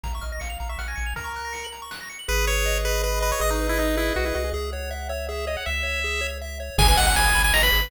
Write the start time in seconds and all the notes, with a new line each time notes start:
0.04 A#1 F5 A#5, kick, closed hi-hat
0.13 E5 C#6
0.21 A#1 D#5 F6, closed hi-hat
0.32 D#5 A#6
0.40 A#1 F5 C#7, closed hi-hat
0.50 F7
0.60 A#1 A#5, closed hi-hat
0.69 E5 C#6
0.79 A#1 F#5 F6, snare
0.88 G#5 A#6
0.96 A#1 C#7, closed hi-hat
1.06 F7
1.16 A#4 A#5, kick, closed hi-hat
1.24 C#6
1.35 F#6, closed hi-hat
1.45 A#6
1.53 C#7, closed hi-hat
1.64 F#7
1.72 A#5, closed hi-hat
1.82 C#6
1.91 F#6, snare
2.01 A#6
2.09 C#7, closed hi-hat
2.19 F#7
2.28 G#1 G#4 B4
2.47 B4 C#5
2.66 D#5
2.85 G#4 B4
3.04 B4
3.21 B4 D#5
3.32 C#5
3.39 G#1 G#4 D#5
3.50 D#4
3.60 B4
3.69 E4
3.77 D#4 D#5
3.96 E4 G#4
4.14 B1 F#4 B4
4.25 E4
4.35 C2 F#4 D#5
4.44 G#4
4.54 C#2 G#4 E5
4.72 C#5 F#5
4.91 E5
5.09 C#5 E5
5.29 G#4 E5
5.47 C#5 D#5
5.57 F#5
5.66 C#2 E5
5.83 C#5
6.04 G#4
6.21 C#5
6.41 E5
6.60 C#5
6.78 G#1 G#4 G#5, kick, crash
6.88 B4 G#5
6.97 G#1 D#5 F#5, closed hi-hat
7.05 F#5 G#5
7.16 G#1 G#5 B5, closed hi-hat
7.24 D#6
7.35 G#1 B5, closed hi-hat
7.44 G#5
7.53 G#1 D#5 A#5, snare
7.63 B4 B5
7.72 G#1 G#4, closed hi-hat
7.82 B4